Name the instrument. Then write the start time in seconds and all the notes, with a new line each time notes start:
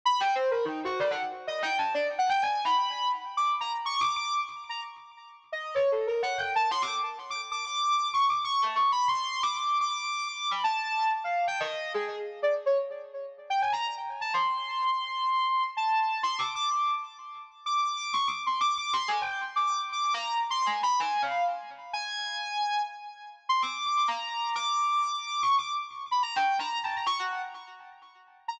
ocarina
0.05 B5
0.20 G5
0.35 C5
0.51 A#4
0.65 D#4
0.85 F#4
1.00 D5
1.11 F#5
1.47 D#5
1.62 G5
1.78 A5
1.94 D5
2.18 F#5
2.29 G5
2.42 G#5
2.64 B5
3.37 D6
3.60 A#5
3.86 C#6
4.00 D6
4.16 D6
4.69 A#5
5.52 D#5
5.75 C#5
5.92 A4
6.07 A#4
6.23 F#5
6.38 G5
6.55 A5
6.71 C6
6.82 D6
7.30 D6
7.41 D6
7.52 D6
7.65 D6
8.13 C#6
8.29 D6
8.44 C#6
8.62 A5
8.75 C#6
8.92 B5
9.08 C6
9.43 D6
9.57 D6
9.81 D6
10.27 D6
10.51 B5
10.64 A5
11.24 F5
11.47 G5
11.60 D#5
11.94 G#4
12.42 D5
12.66 C#5
13.50 G5
13.61 G#5
13.73 A#5
14.21 A5
14.33 C6
15.77 A5
16.23 C6
16.38 D6
16.55 D6
16.69 D6
17.66 D6
17.82 D6
17.97 D6
18.13 C#6
18.27 D6
18.46 C6
18.61 D6
18.78 D6
18.93 C6
19.08 G#5
19.21 G5
19.56 D6
19.67 D6
19.92 D6
20.14 A#5
20.50 C6
20.66 G#5
20.83 B5
20.99 G#5
21.22 F5
21.93 G#5
23.49 C6
23.62 D6
23.86 D6
24.08 A#5
24.55 D6
25.14 D6
25.27 D6
25.42 C#6
25.58 D6
26.11 B5
26.23 A#5
26.36 G5
26.59 A#5
26.83 A5
26.96 A#5
27.06 C#6
27.19 F#5
28.48 A#5